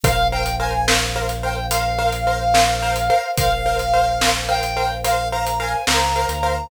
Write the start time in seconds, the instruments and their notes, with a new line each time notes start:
0.04 synth bass 2 A#1, acoustic grand piano A#4 C5 F5, choir aahs A#4 C5 F5, brass section F5, kick, closed hi-hat
0.32 acoustic grand piano A#4 C5 F5, brass section G5
0.46 closed hi-hat
0.60 acoustic grand piano A#4 C5 F5, brass section G#5
0.88 acoustic grand piano A#4 C5 F5, snare
1.16 acoustic grand piano A#4 C5 F5
1.29 closed hi-hat
1.43 acoustic grand piano A#4 C5 F5, brass section G5
1.71 acoustic grand piano A#4 C5 F5, brass section F5, closed hi-hat
1.98 acoustic grand piano A#4 C5 F5
2.12 closed hi-hat
2.27 acoustic grand piano A#4 C5 F5
2.54 acoustic grand piano A#4 C5 F5, snare
2.82 acoustic grand piano A#4 C5 F5
2.96 closed hi-hat
3.10 acoustic grand piano A#4 C5 F5
3.37 synth bass 2 A#1, acoustic grand piano A#4 C5 F5, brass section F5, kick, closed hi-hat
3.66 acoustic grand piano A#4 C5 F5
3.79 closed hi-hat
3.93 acoustic grand piano A#4 C5 F5
4.21 acoustic grand piano A#4 C5 F5, snare
4.48 acoustic grand piano A#4 C5 F5, brass section G5
4.63 closed hi-hat
4.77 acoustic grand piano A#4 C5 F5
5.04 acoustic grand piano A#4 C5 F5, brass section F5, closed hi-hat
5.32 acoustic grand piano A#4 C5 F5, brass section A#5
5.47 closed hi-hat
5.60 acoustic grand piano A#4 C5 F5, brass section G#5
5.87 synth bass 2 C#2, acoustic grand piano A#4 C5 F5, brass section A#5, snare
6.16 acoustic grand piano A#4 C5 F5
6.29 synth bass 2 D2, closed hi-hat
6.43 acoustic grand piano A#4 C5 F5